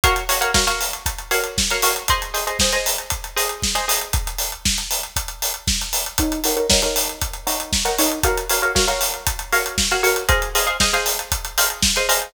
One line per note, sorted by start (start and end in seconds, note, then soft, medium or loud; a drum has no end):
0.04 0.24 F#4 medium
0.04 0.24 A#4 medium
0.04 0.24 C#5 loud
0.04 0.24 F5 medium
0.04 kick medium
0.04 closed hi-hat medium
0.16 closed hi-hat medium
0.29 0.39 F#4 medium
0.29 0.39 A#4 medium
0.29 0.39 C#5 medium
0.29 0.39 F5 medium
0.29 open hi-hat medium
0.41 0.51 F#4 medium
0.41 0.51 A#4 medium
0.41 0.51 C#5 medium
0.41 0.51 F5 medium
0.41 closed hi-hat medium
0.54 0.65 F#4 medium
0.54 0.65 A#4 medium
0.54 0.65 C#5 medium
0.54 0.65 F5 medium
0.54 kick medium
0.54 snare medium
0.67 1.08 F#4 medium
0.67 1.08 A#4 medium
0.67 1.08 C#5 medium
0.67 1.08 F5 medium
0.67 closed hi-hat medium
0.81 open hi-hat medium
0.93 closed hi-hat medium
1.06 kick medium
1.06 closed hi-hat medium
1.18 closed hi-hat medium
1.31 1.62 F#4 medium
1.31 1.62 A#4 medium
1.31 1.62 C#5 medium
1.31 1.62 F5 medium
1.31 open hi-hat medium
1.44 closed hi-hat medium
1.58 kick medium
1.58 snare medium
1.70 1.81 F#4 medium
1.70 1.81 A#4 medium
1.70 1.81 C#5 medium
1.70 1.81 F5 medium
1.70 closed hi-hat medium
1.82 2.04 F#4 medium
1.82 2.04 A#4 medium
1.82 2.04 C#5 medium
1.82 2.04 F5 medium
1.82 open hi-hat medium
1.96 closed hi-hat medium
2.08 2.30 G#4 medium
2.08 2.30 C5 medium
2.08 2.30 D#5 medium
2.08 kick medium
2.08 closed hi-hat medium
2.22 closed hi-hat medium
2.34 2.44 G#4 medium
2.34 2.44 C5 medium
2.34 2.44 D#5 medium
2.34 open hi-hat medium
2.47 2.57 G#4 medium
2.47 2.57 C5 medium
2.47 2.57 D#5 medium
2.47 closed hi-hat medium
2.59 2.71 G#4 medium
2.59 2.71 C5 medium
2.59 2.71 D#5 medium
2.59 kick medium
2.59 snare medium
2.72 3.14 G#4 medium
2.72 3.14 C5 medium
2.72 3.14 D#5 medium
2.72 closed hi-hat medium
2.86 open hi-hat medium
2.98 closed hi-hat medium
3.10 kick medium
3.10 closed hi-hat medium
3.24 closed hi-hat medium
3.37 3.67 G#4 medium
3.37 3.67 C5 medium
3.37 3.67 D#5 medium
3.37 open hi-hat medium
3.49 closed hi-hat medium
3.63 kick medium
3.63 snare medium
3.75 3.85 G#4 medium
3.75 3.85 C5 medium
3.75 3.85 D#5 medium
3.75 closed hi-hat medium
3.88 4.09 G#4 medium
3.88 4.09 C5 medium
3.88 4.09 D#5 medium
3.88 open hi-hat medium
4.01 closed hi-hat medium
4.13 kick medium
4.13 closed hi-hat medium
4.27 closed hi-hat medium
4.38 open hi-hat medium
4.52 closed hi-hat medium
4.65 kick medium
4.65 snare medium
4.78 closed hi-hat medium
4.91 open hi-hat medium
5.03 closed hi-hat medium
5.16 kick medium
5.16 closed hi-hat medium
5.28 closed hi-hat medium
5.42 open hi-hat medium
5.54 closed hi-hat medium
5.67 kick medium
5.67 snare medium
5.81 closed hi-hat medium
5.93 open hi-hat medium
6.06 closed hi-hat medium
6.18 6.40 D#4 loud
6.18 6.40 A#4 medium
6.18 6.40 C#5 loud
6.18 6.40 F#5 medium
6.18 kick medium
6.18 closed hi-hat medium
6.32 closed hi-hat medium
6.44 6.55 D#4 medium
6.44 6.55 A#4 medium
6.44 6.55 C#5 medium
6.44 6.55 F#5 medium
6.44 open hi-hat medium
6.56 6.67 D#4 medium
6.56 6.67 A#4 medium
6.56 6.67 C#5 medium
6.56 6.67 F#5 medium
6.56 closed hi-hat medium
6.70 6.80 D#4 medium
6.70 6.80 A#4 medium
6.70 6.80 C#5 medium
6.70 6.80 F#5 medium
6.70 kick medium
6.70 snare loud
6.82 7.24 D#4 medium
6.82 7.24 A#4 medium
6.82 7.24 C#5 medium
6.82 7.24 F#5 medium
6.82 closed hi-hat medium
6.96 open hi-hat medium
7.09 closed hi-hat medium
7.21 kick medium
7.21 closed hi-hat medium
7.33 closed hi-hat medium
7.47 7.77 D#4 medium
7.47 7.77 A#4 medium
7.47 7.77 C#5 medium
7.47 7.77 F#5 medium
7.47 open hi-hat medium
7.60 closed hi-hat medium
7.73 kick medium
7.73 snare medium
7.85 7.95 D#4 medium
7.85 7.95 A#4 medium
7.85 7.95 C#5 medium
7.85 7.95 F#5 medium
7.85 closed hi-hat medium
7.99 8.19 D#4 medium
7.99 8.19 A#4 medium
7.99 8.19 C#5 medium
7.99 8.19 F#5 medium
7.99 open hi-hat medium
8.12 closed hi-hat medium
8.23 8.45 F#4 medium
8.23 8.45 A#4 medium
8.23 8.45 C#5 medium
8.23 8.45 F5 medium
8.23 kick medium
8.23 closed hi-hat medium
8.38 closed hi-hat medium
8.49 8.61 F#4 medium
8.49 8.61 A#4 medium
8.49 8.61 C#5 medium
8.49 8.61 F5 medium
8.49 open hi-hat medium
8.62 8.72 F#4 medium
8.62 8.72 A#4 medium
8.62 8.72 C#5 medium
8.62 8.72 F5 medium
8.62 closed hi-hat medium
8.75 8.85 F#4 medium
8.75 8.85 A#4 medium
8.75 8.85 C#5 medium
8.75 8.85 F5 medium
8.75 kick medium
8.75 snare medium
8.88 9.29 F#4 medium
8.88 9.29 A#4 medium
8.88 9.29 C#5 medium
8.88 9.29 F5 medium
8.88 closed hi-hat medium
9.01 open hi-hat medium
9.14 closed hi-hat medium
9.27 kick medium
9.27 closed hi-hat medium
9.39 closed hi-hat medium
9.53 9.83 F#4 medium
9.53 9.83 A#4 medium
9.53 9.83 C#5 medium
9.53 9.83 F5 medium
9.53 open hi-hat medium
9.66 closed hi-hat medium
9.78 kick medium
9.78 snare medium
9.91 10.02 F#4 medium
9.91 10.02 A#4 medium
9.91 10.02 C#5 medium
9.91 10.02 F5 medium
9.91 closed hi-hat medium
10.03 10.24 F#4 medium
10.03 10.24 A#4 medium
10.03 10.24 C#5 medium
10.03 10.24 F5 medium
10.03 open hi-hat medium
10.16 closed hi-hat medium
10.29 10.49 G#4 medium
10.29 10.49 C5 medium
10.29 10.49 D#5 medium
10.29 10.49 F5 loud
10.29 kick loud
10.29 closed hi-hat medium
10.42 closed hi-hat medium
10.55 10.65 G#4 medium
10.55 10.65 C5 medium
10.55 10.65 D#5 medium
10.55 10.65 F5 medium
10.55 open hi-hat medium
10.67 10.77 G#4 medium
10.67 10.77 C5 medium
10.67 10.77 D#5 medium
10.67 10.77 F5 medium
10.67 closed hi-hat medium
10.80 10.91 G#4 medium
10.80 10.91 C5 medium
10.80 10.91 D#5 medium
10.80 10.91 F5 medium
10.80 kick medium
10.80 snare medium
10.93 11.34 G#4 medium
10.93 11.34 C5 medium
10.93 11.34 D#5 medium
10.93 11.34 F5 medium
10.93 closed hi-hat medium
11.06 open hi-hat medium
11.19 closed hi-hat medium
11.32 kick medium
11.32 closed hi-hat medium
11.45 closed hi-hat medium
11.58 11.89 G#4 medium
11.58 11.89 C5 medium
11.58 11.89 D#5 medium
11.58 11.89 F5 medium
11.58 open hi-hat medium
11.70 closed hi-hat medium
11.82 kick medium
11.82 snare loud
11.96 12.07 G#4 medium
11.96 12.07 C5 medium
11.96 12.07 D#5 medium
11.96 12.07 F5 medium
11.96 closed hi-hat medium
12.09 12.29 G#4 medium
12.09 12.29 C5 medium
12.09 12.29 D#5 medium
12.09 12.29 F5 medium
12.09 open hi-hat medium
12.22 closed hi-hat medium